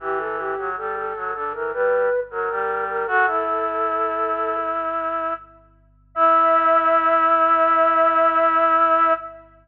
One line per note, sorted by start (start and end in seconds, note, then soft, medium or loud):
0.00 0.55 E3 medium
0.00 0.19 G4 loud
0.19 0.37 A4 medium
0.38 0.69 G4 medium
0.58 0.76 F#3 medium
0.77 1.13 G3 medium
0.77 0.96 A4 medium
0.96 1.31 A4 medium
1.15 1.33 F#3 medium
1.34 1.53 D3 medium
1.34 1.53 A4 loud
1.54 1.72 E3 medium
1.54 1.72 A#4 medium
1.73 2.09 G3 medium
1.73 2.20 B4 loud
2.30 2.49 F#3 medium
2.30 2.84 A#4 medium
2.50 3.04 G3 medium
2.89 3.07 A#4 medium
3.07 3.26 F#4 medium
3.07 4.56 A4 loud
3.27 5.33 E4 medium
6.15 9.13 E4 loud
6.15 9.13 E5 loud